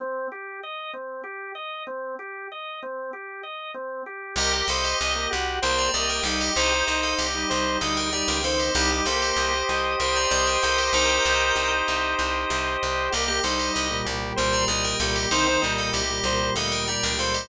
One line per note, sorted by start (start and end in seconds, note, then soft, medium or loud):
0.00 0.27 C4 medium
0.32 0.60 G4 medium
0.63 0.91 D#5 medium
0.93 1.22 C4 medium
1.24 1.52 G4 medium
1.55 1.83 D#5 medium
1.87 2.15 C4 medium
2.19 2.47 G4 medium
2.52 2.80 D#5 medium
2.83 3.11 C4 medium
3.13 3.41 G4 medium
3.43 3.71 D#5 medium
3.74 4.02 C4 medium
4.06 4.34 G4 medium
4.36 4.62 C2 loud
4.36 4.65 G4 loud
4.36 4.52 G4 loud
4.36 4.52 A#4 medium
4.36 4.52 D#5 loud
4.36 4.52 G5 medium
4.53 4.68 G4 medium
4.53 4.68 A#4 medium
4.53 4.68 D#5 medium
4.53 4.68 G5 medium
4.68 4.94 C2 loud
4.68 5.12 G4 medium
4.68 4.83 A4 medium
4.68 4.97 C5 medium
4.68 5.12 D#5 medium
4.68 4.83 F5 medium
4.84 5.24 G4 medium
4.84 5.24 D#5 medium
5.01 5.27 C2 loud
5.01 5.29 D#5 medium
5.15 5.30 A#3 medium
5.15 5.30 G4 medium
5.30 5.59 C2 loud
5.30 5.60 F#4 medium
5.30 5.58 G4 medium
5.62 5.89 C2 loud
5.62 5.88 A#3 medium
5.62 5.88 G4 medium
5.62 5.77 A#4 medium
5.62 5.90 C5 loud
5.62 5.77 G5 medium
5.78 5.93 D5 medium
5.78 5.93 A#5 medium
5.94 6.21 C2 medium
5.94 6.22 A#3 medium
5.94 6.22 G4 medium
5.94 6.09 D5 medium
5.94 6.22 D#5 medium
5.94 6.09 A#5 medium
6.09 6.24 A#4 medium
6.09 6.24 G5 medium
6.23 6.50 C2 loud
6.23 6.51 G3 medium
6.23 6.51 D#4 medium
6.23 6.53 G4 medium
6.23 6.40 A4 medium
6.23 6.40 F5 medium
6.41 6.55 G4 medium
6.41 6.55 D#5 medium
6.56 6.83 C2 loud
6.56 6.98 D#4 medium
6.56 6.71 G4 medium
6.56 6.84 C5 medium
6.56 6.98 C5 medium
6.56 6.71 D#5 loud
6.72 6.87 G4 medium
6.72 6.87 D#5 medium
6.87 7.14 C2 medium
6.87 7.26 D#4 medium
6.87 7.26 C5 medium
6.87 7.15 D#5 medium
7.03 7.18 A4 medium
7.03 7.18 F5 medium
7.18 7.45 C2 medium
7.18 7.76 G4 medium
7.18 7.49 G4 medium
7.18 7.76 D#5 medium
7.34 7.49 G3 medium
7.34 7.49 D#4 medium
7.49 7.77 C2 loud
7.49 7.79 G3 medium
7.49 7.79 D#4 medium
7.49 7.77 C5 medium
7.81 8.23 D2 medium
7.81 8.09 G3 medium
7.81 8.09 D#4 medium
7.81 7.96 A4 medium
7.81 8.10 D#5 medium
7.81 7.96 F5 medium
7.97 8.12 A#4 medium
7.97 8.12 G5 medium
8.12 8.38 G3 medium
8.12 8.38 D#4 medium
8.12 8.41 G4 medium
8.12 8.27 D5 medium
8.12 8.27 A#5 medium
8.28 8.70 C#2 loud
8.28 8.43 A#4 medium
8.28 8.43 G5 medium
8.44 8.70 D#3 medium
8.44 8.70 C4 medium
8.44 8.59 A4 medium
8.44 8.73 C5 medium
8.44 8.59 F5 medium
8.60 8.74 G4 medium
8.60 8.74 D#5 medium
8.75 9.01 C2 loud
8.75 8.90 G3 medium
8.75 8.90 D#4 medium
8.75 8.90 G4 loud
8.75 9.69 G4 loud
8.75 8.90 D#5 loud
8.91 9.05 G3 medium
8.91 9.05 D#4 medium
8.91 9.06 G4 medium
8.91 9.06 D#5 medium
9.06 9.32 C2 medium
9.06 9.50 A#3 medium
9.06 9.50 G4 medium
9.06 9.21 A4 medium
9.06 9.99 C5 medium
9.06 9.21 F5 medium
9.22 9.62 G4 medium
9.22 9.62 D#5 medium
9.36 9.63 C2 loud
9.36 10.31 D#5 medium
9.53 9.68 G4 medium
9.53 9.68 D#5 medium
9.69 9.96 C2 medium
9.69 9.97 G4 medium
9.69 10.62 G4 loud
9.69 9.97 D#5 medium
9.99 10.26 C2 medium
9.99 10.25 G4 medium
9.99 10.15 A#4 medium
9.99 10.93 C5 loud
9.99 10.25 D#5 medium
9.99 10.15 G5 medium
10.16 10.31 D5 medium
10.16 10.31 A#5 medium
10.31 10.58 C2 loud
10.31 10.57 G4 medium
10.31 10.46 D5 medium
10.31 10.57 D#5 medium
10.31 11.25 D#5 medium
10.31 10.46 A#5 medium
10.47 10.62 A#4 medium
10.47 10.62 G5 medium
10.62 10.90 C2 medium
10.62 11.55 G4 medium
10.62 10.77 A4 medium
10.62 10.88 A#4 medium
10.62 10.77 F5 medium
10.62 10.88 G5 medium
10.78 10.93 G4 medium
10.78 10.93 D#5 medium
10.93 11.19 C2 loud
10.93 12.66 D#4 medium
10.93 11.71 A#4 medium
10.93 11.87 C5 medium
10.93 12.66 C5 loud
10.93 11.71 G5 medium
11.25 11.52 C2 loud
11.25 12.17 D#5 loud
11.55 11.82 C2 medium
11.55 12.50 G4 medium
11.87 12.15 C2 medium
11.87 12.82 C5 medium
12.18 12.45 C2 loud
12.18 13.07 D#5 medium
12.50 12.77 C2 loud
12.50 13.10 G4 loud
12.82 13.09 C2 medium
12.82 13.12 C5 medium
13.11 13.40 C2 loud
13.11 13.27 A#3 medium
13.11 13.40 G4 loud
13.11 13.27 G4 medium
13.11 13.27 D#5 medium
13.28 13.43 A#3 medium
13.28 13.43 G4 medium
13.28 13.43 D#5 medium
13.43 13.70 C2 loud
13.43 13.86 G3 medium
13.43 13.86 D#4 medium
13.43 13.59 A4 medium
13.43 13.71 C5 medium
13.43 13.59 F5 medium
13.59 13.98 G4 medium
13.59 13.98 D#5 medium
13.73 14.02 C2 loud
13.73 14.01 D#5 medium
13.91 14.05 A#2 medium
13.91 14.05 G3 medium
14.05 14.33 C2 loud
14.05 14.35 A#2 medium
14.05 14.35 G3 medium
14.05 14.33 G4 medium
14.36 14.65 C2 loud
14.36 14.67 A#2 medium
14.36 14.67 G3 medium
14.36 14.52 A#4 medium
14.36 14.64 C5 loud
14.36 14.52 G5 medium
14.53 14.68 D5 medium
14.53 14.68 A#5 medium
14.68 14.95 C2 medium
14.68 14.96 A#2 medium
14.68 14.96 G3 medium
14.68 14.83 D5 medium
14.68 14.96 D#5 medium
14.68 14.83 A#5 medium
14.84 14.99 A#4 medium
14.84 14.99 G5 medium
15.00 15.26 C2 loud
15.00 15.26 A#2 medium
15.00 15.26 G3 medium
15.00 15.29 G4 medium
15.00 15.15 A4 medium
15.00 15.15 F5 medium
15.16 15.30 G4 medium
15.16 15.30 D#5 medium
15.31 15.58 C2 loud
15.31 15.46 D#3 loud
15.31 15.46 C4 loud
15.31 15.71 D#4 medium
15.31 15.71 C5 medium
15.31 15.60 C5 medium
15.47 15.62 D#3 medium
15.47 15.62 C4 medium
15.62 15.90 C2 medium
15.62 16.01 A#2 medium
15.62 16.01 G3 medium
15.62 15.90 D#5 medium
15.78 15.93 A4 medium
15.78 15.93 F5 medium
15.92 16.20 C2 medium
15.92 16.20 G4 medium
15.92 16.47 G4 medium
15.92 16.47 D#5 medium
16.09 16.24 A#2 medium
16.09 16.24 G3 medium
16.24 16.50 C2 loud
16.24 16.54 A#2 medium
16.24 16.54 G3 medium
16.24 16.53 C5 medium
16.56 16.98 D2 medium
16.56 16.86 A#2 medium
16.56 16.86 G3 medium
16.56 16.71 A4 medium
16.56 16.85 D#5 medium
16.56 16.71 F5 medium
16.72 16.87 A#4 medium
16.72 16.87 G5 medium
16.88 17.13 A#2 medium
16.88 17.13 G3 medium
16.88 17.16 G4 medium
16.88 17.02 D5 medium
16.88 17.02 A#5 medium
17.03 17.45 C#2 loud
17.03 17.18 A#4 medium
17.03 17.18 G5 medium
17.19 17.48 A#2 medium
17.19 17.48 G3 medium
17.19 17.34 A4 medium
17.19 17.47 C5 medium
17.19 17.34 F5 medium
17.34 17.48 G4 medium
17.34 17.48 D#5 medium